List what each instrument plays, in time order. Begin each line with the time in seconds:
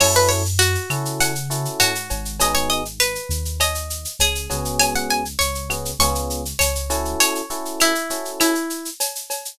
0.00 synth bass 1 F#2, electric piano 1 C#4 E4 F#4 A4, acoustic guitar (steel) C#5, crash, cowbell, claves
0.15 acoustic guitar (steel) B4, shaker
0.29 acoustic guitar (steel) C#5, shaker
0.45 shaker
0.59 acoustic guitar (steel) F#4, shaker
0.75 shaker
0.90 synth bass 1 C#3, electric piano 1 C#4 E4 F#4 A4, claves, shaker
1.05 shaker
1.20 acoustic guitar (steel) F#5, cowbell, shaker
1.35 shaker
1.50 electric piano 1 C#4 E4 F#4 A4, shaker
1.65 shaker
1.80 synth bass 1 G#2, acoustic guitar (steel) F#4, cowbell, claves, shaker
1.95 shaker
2.10 synth bass 1 G#1, cowbell, shaker
2.25 shaker
2.40 electric piano 1 B3 D#4 F#4 G#4, acoustic guitar (steel) D#5, cowbell, shaker
2.55 acoustic guitar (steel) C#5, shaker
2.70 acoustic guitar (steel) D#5, shaker
2.85 shaker
3.00 acoustic guitar (steel) B4, claves, shaker
3.15 shaker
3.29 synth bass 1 D#2, shaker
3.45 shaker
3.60 acoustic guitar (steel) D#5, cowbell, claves, shaker
3.75 shaker
3.90 shaker
4.05 shaker
4.19 synth bass 1 C#2, acoustic guitar (steel) G#4, cowbell, shaker
4.35 shaker
4.50 synth bass 1 C#2, electric piano 1 B3 C#4 F#4 G#4, cowbell, shaker
4.65 shaker
4.79 acoustic guitar (steel) G#5, cowbell, claves, shaker
4.95 acoustic guitar (steel) F#5, shaker
5.10 acoustic guitar (steel) G#5, shaker
5.25 shaker
5.39 synth bass 1 C#2, acoustic guitar (steel) C#5, shaker
5.55 shaker
5.70 electric piano 1 B3 C#4 F#4 G#4, claves, shaker
5.85 shaker
5.99 synth bass 1 C#2, electric piano 1 B3 C#4 F4 G#4, acoustic guitar (steel) C#6, cowbell, shaker
6.15 shaker
6.30 shaker
6.45 shaker
6.59 synth bass 1 C#2, acoustic guitar (steel) C#5, cowbell, claves, shaker
6.75 shaker
6.90 electric piano 1 C#4 E4 F#4 A4, cowbell, shaker
7.05 shaker
7.20 acoustic guitar (steel) C#5, cowbell, shaker
7.35 shaker
7.50 electric piano 1 C#4 E4 F#4 A4, shaker
7.65 shaker
7.80 acoustic guitar (steel) E4, claves, shaker
7.95 shaker
8.10 electric piano 1 C#4 E4 F#4 A4, shaker
8.25 shaker
8.40 acoustic guitar (steel) E4, cowbell, claves, shaker
8.55 shaker
8.70 shaker
8.85 shaker
9.00 cowbell, shaker
9.15 shaker
9.30 cowbell, shaker
9.45 shaker